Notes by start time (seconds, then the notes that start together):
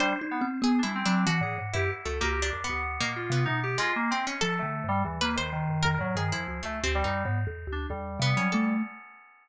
0.00 G3 D4 C5
0.21 D#4
0.31 B3
0.41 C4
0.62 B3 G#4
0.79 D4
0.83 G3 E4
0.95 C4
1.06 F#3 D4
1.27 E3 F#4
1.41 A2 G#4
1.58 G#2
1.74 F#2 E4 G4
2.05 C#2 A3 A4
2.21 C#2 A#3 G4
2.42 D4
2.53 F2
2.64 B3
2.69 D2
3.01 A#2 A#3
3.16 F4
3.30 C3 B3
3.45 B2 D#4
3.63 G4
3.78 G#3 F4
3.96 A#3
4.11 C4
4.27 C#4
4.41 F3 A4
4.59 D3 A3
4.84 G2
4.88 G3
5.04 D#2 E3
5.21 A#3 B4
5.36 D#3 C5
5.52 D#3
5.69 F#2
5.83 F2 A#4
5.99 A2 F#3
6.16 G2 D#3 G#4
6.32 F2 F3 E4
6.48 C#2
6.63 C#2 A3
6.84 D2 C4
6.95 G3
7.04 F#2 D#4
7.24 G#2 B3
7.47 E2
7.67 D2
7.72 D4
7.90 E2 G3
8.20 C3 B3
8.37 F#3 C#4
8.52 A3 A4